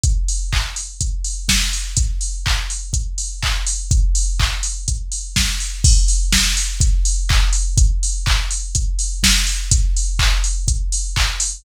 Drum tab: CC |--------|--------|--------|x-------|
HH |xo-oxo-o|xo-oxo-o|xo-oxo-o|-o-oxo-o|
CP |--x-----|--x---x-|--x-----|------x-|
SD |------o-|--------|------o-|--o-----|
BD |o-o-o-o-|o-o-o-o-|o-o-o-o-|o-o-o-o-|

CC |--------|--------|
HH |xo-oxo-o|xo-oxo-o|
CP |--x-----|--x---x-|
SD |------o-|--------|
BD |o-o-o-o-|o-o-o-o-|